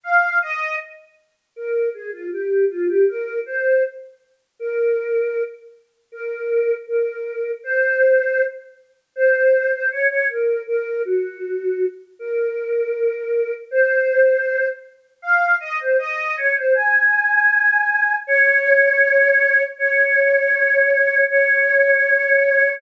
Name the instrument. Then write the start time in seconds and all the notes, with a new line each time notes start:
choir aahs
0.04 F5
0.42 D#5
1.56 A#4
1.94 G#4
2.13 F4
2.32 G4
2.70 F4
2.88 G4
3.08 A#4
3.46 C5
4.59 A#4
6.12 A#4
6.87 A#4
7.64 C5
9.16 C5
9.73 C5
9.91 C#5
10.10 C#5
10.29 A#4
10.67 A#4
11.05 F#4
12.19 A#4
13.71 C5
15.22 F5
15.60 D#5
15.80 C5
15.99 D#5
16.37 C#5
16.56 C5
16.74 G#5
18.27 C#5
19.78 C#5
21.30 C#5